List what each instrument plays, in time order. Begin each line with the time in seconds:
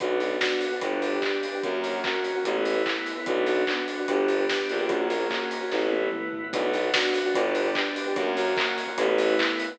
0.00 violin B1, pad 5 (bowed) B3 D4 F#4, electric piano 1 B3 D4 F#4, kick, closed hi-hat
0.20 electric piano 1 B3 D4 F#4, snare, open hi-hat
0.41 electric piano 1 B3 D4 F#4, kick, snare
0.61 open hi-hat
0.72 electric piano 1 B3 D4 F#4
0.81 violin G1, electric piano 1 B3 D4 G4, pad 5 (bowed) B3 D4 G4, kick, closed hi-hat
1.02 open hi-hat
1.13 electric piano 1 B3 D4 G4
1.22 kick, clap
1.43 open hi-hat
1.53 electric piano 1 B3 D4 G4
1.63 violin F#2, pad 5 (bowed) A#3 C#4 F#4, electric piano 1 A#3 C#4 F#4, kick, closed hi-hat
1.84 electric piano 1 A#3 C#4 F#4, snare, open hi-hat
2.04 electric piano 1 A#3 C#4 F#4, kick, clap
2.24 open hi-hat
2.35 electric piano 1 A#3 C#4 F#4
2.44 violin A1, electric piano 1 A3 B3 E4, pad 5 (bowed) A3 B3 E4, kick, closed hi-hat
2.65 open hi-hat
2.75 electric piano 1 A3 B3 E4
2.86 kick, clap
3.06 open hi-hat
3.16 electric piano 1 A3 B3 E4
3.26 violin B1, pad 5 (bowed) B3 D4 F#4, electric piano 1 B3 D4 F#4, kick, closed hi-hat
3.46 electric piano 1 B3 D4 F#4, snare, open hi-hat
3.67 electric piano 1 B3 D4 F#4, kick, clap
3.88 open hi-hat
3.98 electric piano 1 B3 D4 F#4
4.08 violin G1, pad 5 (bowed) B3 D4 G4, electric piano 1 B3 D4 G4, kick, closed hi-hat
4.28 open hi-hat
4.39 electric piano 1 B3 D4 G4
4.49 kick, snare
4.69 violin A#1, open hi-hat
4.79 electric piano 1 B3 D4 G4
4.89 electric piano 1 A#3 C#4 F#4, pad 5 (bowed) A#3 C#4 F#4, kick, closed hi-hat
5.10 electric piano 1 A#3 C#4 F#4, snare, open hi-hat
5.30 electric piano 1 A#3 C#4 F#4, kick, clap
5.51 open hi-hat
5.61 electric piano 1 A#3 C#4 F#4
5.71 violin A1, pad 5 (bowed) A3 B3 E4, electric piano 1 A3 B3 E4, kick, snare
5.92 high tom
6.02 electric piano 1 A3 B3 E4
6.12 mid tom
6.33 floor tom
6.43 electric piano 1 A3 B3 E4
6.53 violin B1, pad 5 (bowed) B3 D4 F#4, electric piano 1 B3 D4 F#4, kick, closed hi-hat
6.73 electric piano 1 B3 D4 F#4, snare, open hi-hat
6.93 electric piano 1 B3 D4 F#4, kick, snare
7.14 open hi-hat
7.24 electric piano 1 B3 D4 F#4
7.34 violin G1, electric piano 1 B3 D4 G4, pad 5 (bowed) B3 D4 G4, kick, closed hi-hat
7.55 open hi-hat
7.65 electric piano 1 B3 D4 G4
7.75 kick, clap
7.96 open hi-hat
8.06 electric piano 1 B3 D4 G4
8.16 violin F#2, electric piano 1 A#3 C#4 F#4, pad 5 (bowed) A#3 C#4 F#4, kick, closed hi-hat
8.37 electric piano 1 A#3 C#4 F#4, snare, open hi-hat
8.57 electric piano 1 A#3 C#4 F#4, kick, clap
8.78 open hi-hat
8.88 electric piano 1 A#3 C#4 F#4
8.98 violin A1, electric piano 1 A3 B3 E4, pad 5 (bowed) A3 B3 E4, kick, closed hi-hat
9.18 open hi-hat
9.29 electric piano 1 A3 B3 E4
9.39 kick, clap
9.59 open hi-hat
9.69 electric piano 1 A3 B3 E4